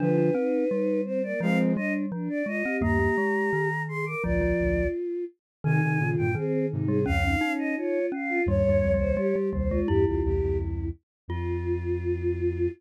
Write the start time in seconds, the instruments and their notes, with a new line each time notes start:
0.00 flute D3 F3, glockenspiel D4, choir aahs F4 B4
0.18 glockenspiel D4
0.34 glockenspiel C4, choir aahs D#4
0.69 glockenspiel G3, choir aahs D#4
1.04 choir aahs C4 C5
1.23 choir aahs A#3 D5
1.40 glockenspiel F3, flute F3 G#3, choir aahs C4 F5
1.75 glockenspiel G3, choir aahs D4 D#5
2.12 glockenspiel F3, choir aahs D4
2.30 choir aahs D5
2.46 glockenspiel G#3, choir aahs F4 D#5
2.65 glockenspiel C4, choir aahs G4
2.81 flute D#2 G2, glockenspiel A#3, choir aahs G4 A#5
3.00 glockenspiel A#3
3.18 glockenspiel G#3
3.53 glockenspiel D#3
3.88 choir aahs G#4 C6
4.05 choir aahs A#4 D6
4.23 flute A#1 D2, glockenspiel F3, choir aahs F4 D5
4.41 glockenspiel F3
4.60 flute A#1 D2
5.64 flute C3 D#3, glockenspiel D#3, choir aahs D#4 G#5
5.82 flute C3 D#3, choir aahs D#4
5.99 flute A#2 C#3, choir aahs F4
6.18 flute G2 A#2, choir aahs G5
6.35 glockenspiel D#3, choir aahs C4 G#4
6.70 flute G#2 C3, choir aahs D#4
6.88 glockenspiel G3, choir aahs G#4
7.06 flute C#2 F2, glockenspiel C#4, choir aahs C#4 F5
7.25 choir aahs D#4
7.41 choir aahs C#4, glockenspiel D#4
7.59 choir aahs D#5
7.76 choir aahs F4 C#5
8.12 glockenspiel C#4, choir aahs F5
8.29 choir aahs F4
8.46 flute D#2 G2, glockenspiel G3, choir aahs C#5
8.65 flute D#2 G2
8.69 glockenspiel G3
8.83 flute C#2 F2
8.94 glockenspiel G3
8.99 flute C2 D#2, choir aahs C5
9.17 glockenspiel G3, choir aahs G4
9.36 glockenspiel G3
9.51 flute C2 D#2, glockenspiel G3, choir aahs C5
9.70 glockenspiel G#3, choir aahs F4
9.87 flute E2 G2, glockenspiel E4, choir aahs G4
10.05 flute C2 E2, choir aahs F4 G4
10.23 flute C2 E2, choir aahs E4 G4
10.42 flute C#2 F2
11.28 flute F2, choir aahs F4, glockenspiel F4